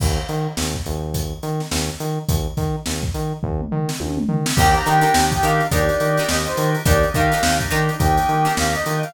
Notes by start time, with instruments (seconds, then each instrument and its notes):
0.00 synth bass 1 D#2, kick, crash
0.29 synth bass 1 D#3, closed hi-hat
0.57 synth bass 1 D#2, snare
0.75 kick
0.86 synth bass 1 D#2, closed hi-hat
1.14 kick, closed hi-hat
1.43 synth bass 1 D#3, closed hi-hat
1.60 snare
1.71 synth bass 1 D#2, snare
2.00 synth bass 1 D#3, closed hi-hat
2.29 synth bass 1 D#2, kick, closed hi-hat
2.57 synth bass 1 D#3, kick, snare, closed hi-hat
2.86 synth bass 1 D#2, snare
3.03 kick
3.14 synth bass 1 D#3, closed hi-hat
3.43 synth bass 1 D#2, kick
3.60 mid tom
3.71 synth bass 1 D#3, floor tom
3.89 snare
4.00 synth bass 1 D#2, high tom
4.17 mid tom
4.29 synth bass 1 D#3, floor tom
4.46 snare
4.56 synth bass 1 D#2, drawbar organ A#3 D4 D#4 G4, pizzicato strings D4 D#4, brass section G5, kick, crash
4.60 pizzicato strings G4 A#4
4.75 brass section A#5, closed hi-hat
4.86 synth bass 1 D#3, pizzicato strings D4 D#4 G4 A#4, brass section G5, closed hi-hat
5.01 pizzicato strings D4 D#4 G4 A#4, closed hi-hat
5.14 synth bass 1 D#2, snare
5.32 brass section G5, kick, snare, closed hi-hat
5.43 synth bass 1 D#3, pizzicato strings D4 D#4 G4 A#4, brass section F5, snare, closed hi-hat
5.60 closed hi-hat
5.71 synth bass 1 D#2, drawbar organ A#3 D4 D#4 G4, pizzicato strings D4 D#4 G4 A#4, brass section D5, kick, closed hi-hat
5.89 closed hi-hat
6.00 synth bass 1 D#3, closed hi-hat
6.17 pizzicato strings D4 D#4 G4 A#4, snare, closed hi-hat
6.28 synth bass 1 D#2, brass section D#5, snare
6.46 brass section C5, closed hi-hat
6.57 synth bass 1 D#3, closed hi-hat
6.75 closed hi-hat
6.85 synth bass 1 D#2, drawbar organ A#3 D4 D#4 G4, pizzicato strings D4 D#4 G4 A#4, brass section D5, kick, closed hi-hat
7.03 closed hi-hat
7.14 synth bass 1 D#3, pizzicato strings D4 D#4 G4 A#4, brass section F5, kick, closed hi-hat
7.32 pizzicato strings D4 D#4 G4 A#4, closed hi-hat
7.43 synth bass 1 D#2, snare
7.60 kick, closed hi-hat
7.71 synth bass 1 D#3, pizzicato strings D4 D#4 G4 A#4, closed hi-hat
7.89 closed hi-hat
7.99 synth bass 1 D#2, drawbar organ A#3 D4 D#4 G4, brass section G5, kick, closed hi-hat
8.17 closed hi-hat
8.29 synth bass 1 D#3, closed hi-hat
8.45 pizzicato strings D4 D#4 G4 A#4, snare, closed hi-hat
8.57 synth bass 1 D#2, brass section F5, snare
8.74 brass section D#5, closed hi-hat
8.86 synth bass 1 D#3, closed hi-hat
9.03 brass section F5, closed hi-hat